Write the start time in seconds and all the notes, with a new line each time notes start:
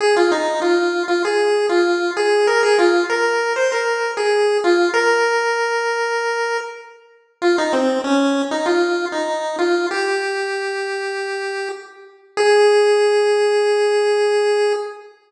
0.01 G#4
0.16 F4
0.31 D#4
0.62 F4
1.08 F4
1.25 G#4
1.69 F4
2.17 G#4
2.47 A#4
2.63 G#4
2.78 F4
3.10 A#4
3.56 C5
3.72 A#4
4.17 G#4
4.64 F4
4.94 A#4
7.42 F4
7.58 D#4
7.73 C4
8.04 C#4
8.51 D#4
8.66 F4
9.12 D#4
9.59 F4
9.91 G4
12.37 G#4